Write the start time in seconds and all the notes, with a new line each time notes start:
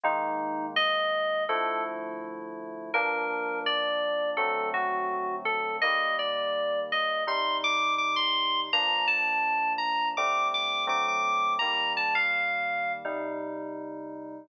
0.03 D#3 G#3 A#3 D#4
0.76 D#5
1.49 D3 F3 A3 E4 A4
2.94 G2 F3 A#3 D4 A#4
3.66 D5
4.37 D3 F#3 A3 C4 A4
4.74 F#4
5.45 A4
5.81 D#3 G3 A#3 D#5
6.19 D5
6.92 D#5
7.27 C3 G3 D#4 C6
7.64 D6
7.98 D6
8.16 C6
8.73 G2 F3 A#3 D4 A#5
9.07 A5
9.78 A#5
10.17 D3 G3 A3 C4 D6
10.54 D6
10.87 D3 F#3 A3 C4 D6
11.08 D6
11.59 D#3 G3 A#3 A#5
11.97 A5
12.15 F5
13.05 C3 G3 D#4